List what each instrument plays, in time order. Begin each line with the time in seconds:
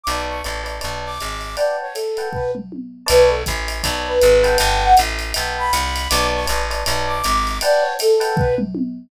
0.04 electric bass (finger) B1, flute D6, ride
0.08 electric piano 1 B4 C#5 D5 A5
0.29 flute C#6
0.44 electric bass (finger) A1, electric piano 1 B4 C#5 D5 A5, hi-hat pedal, ride
0.64 electric piano 1 B4 C#5 D5 A5, ride
0.81 electric bass (finger) B1, electric piano 1 B4 C#5 D5 A5, ride
1.06 flute D6
1.20 electric bass (finger) G#1, hi-hat pedal, ride
1.41 ride
1.57 electric piano 1 B4 F#5 G5 A5, flute D5, ride
1.81 flute C#5
1.95 flute A4, hi-hat pedal, ride
2.17 electric piano 1 B4 F#5 G5 A5, ride
2.33 flute B4, kick, floor tom
2.55 mid tom
2.72 high tom
3.06 electric bass (finger) B1, electric piano 1 B4 C#5 D5 A5, flute B4, ride
3.29 flute A4
3.46 electric bass (finger) A1, kick, hi-hat pedal, ride
3.68 ride
3.83 electric bass (finger) B1, electric piano 1 B4 C#5 D5 A5, kick, ride
4.07 flute B4
4.22 electric bass (finger) G#1, hi-hat pedal, ride
4.44 electric piano 1 B4 F#5 G5 A5, ride
4.58 electric bass (finger) G1, ride
4.63 flute G5
4.83 flute F#5
4.97 electric bass (finger) A1, hi-hat pedal, ride
5.19 ride
5.34 electric bass (finger) B1, electric piano 1 B4 F#5 G5 A5, ride
5.58 flute B5
5.73 electric bass (finger) C2, hi-hat pedal, ride
5.96 ride
6.09 electric bass (finger) B1, electric piano 1 B4 C#5 D5 A5, flute D6, ride
6.35 flute C#6
6.46 electric bass (finger) A1, electric piano 1 B4 C#5 D5 A5, hi-hat pedal, ride
6.70 electric piano 1 B4 C#5 D5 A5, ride
6.86 electric bass (finger) B1, electric piano 1 B4 C#5 D5 A5, ride
7.07 flute D6
7.24 electric bass (finger) G#1, hi-hat pedal, ride
7.47 ride
7.61 electric piano 1 B4 F#5 G5 A5, flute D5, ride
7.81 flute C#5
7.99 flute A4, hi-hat pedal, ride
8.20 electric piano 1 B4 F#5 G5 A5, ride
8.36 flute B4, kick, floor tom
8.58 mid tom
8.75 high tom